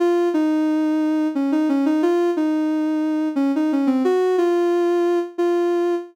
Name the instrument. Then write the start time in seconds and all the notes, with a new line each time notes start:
ocarina
0.00 F4
0.34 D#4
1.35 C#4
1.52 D#4
1.69 C#4
1.86 D#4
2.03 F4
2.37 D#4
3.36 C#4
3.56 D#4
3.72 C#4
3.87 C4
4.04 F#4
4.38 F4
5.38 F4